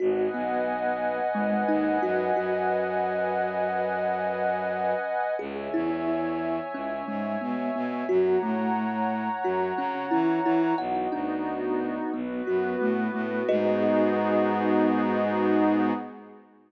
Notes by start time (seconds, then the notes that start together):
0.00 G#1 F#4 B4 D#5 F#5 G#5
0.34 B1 B3
1.35 G#1 G#3
1.68 D#2 D#4
2.02 F#2 F#4
2.36 F#2 F#4
5.39 C#2 G#4 C#5 E5 G#5
5.74 E2 E4
6.74 C#2 C#4
7.08 G#2 G#3
7.41 B2 B3
7.75 B2 B3
8.09 F#2 F#4 C#5 F#5 A#5
8.42 A2 A3
9.44 F#2 F#4
9.77 C#3 C#4
10.11 E3 E4
10.45 E3 E4
10.78 B1 B3 D#4 F#4 F#5
11.12 D2 D4
12.13 B1 B3 F#4 B4
12.47 F#2 F#4
12.80 A2 A3
13.14 A2 A3
13.48 G#2 B3 D#4 F#4 G#4 B4 D#5